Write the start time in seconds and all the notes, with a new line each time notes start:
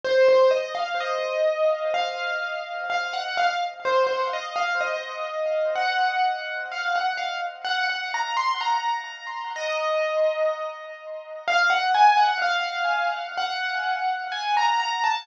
0.05 C5
0.29 C5
0.51 D#5
0.75 F5
1.00 D#5
1.94 F5
2.90 F5
3.13 F#5
3.38 F5
3.85 C5
4.07 C5
4.33 D#5
4.56 F5
4.81 D#5
5.76 F#5
6.72 F5
6.96 F#5
7.17 F5
7.65 F#5
7.90 F#5
8.14 A#5
8.37 C6
8.61 A#5
9.56 D#5
11.48 F5
11.70 F#5
11.95 G#5
12.17 F#5
12.42 F5
13.38 F#5
14.32 G#5
14.57 A#5
14.80 A#5
15.04 A5